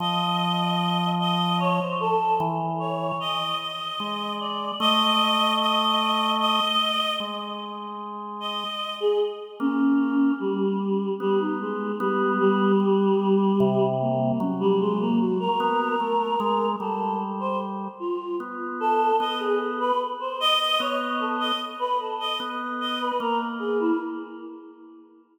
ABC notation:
X:1
M:6/8
L:1/16
Q:3/8=50
K:none
V:1 name="Choir Aahs"
_e6 e2 _d c A2 | z2 _d2 _e2 e4 =d2 | _e4 e4 e4 | z6 _e3 _A z2 |
_D4 G,4 G, _E _A,2 | G,2 G,8 _B,2 | _D G, _A, _B, _G _B7 | A2 z c z2 F2 z2 A2 |
_e _A z B z c e e _d z =A e | z B A _e z2 e B _B z _A =E |]
V:2 name="Drawbar Organ"
F,10 z2 | E,4 z4 _A,4 | A,10 z2 | _A,8 z4 |
_B,4 z4 =B,4 | B,4 G,4 C,4 | _G,6 B,2 A,2 _A,2 | G,6 z2 B,4 |
B,4 z4 B,4 | z4 B,4 _B,4 |]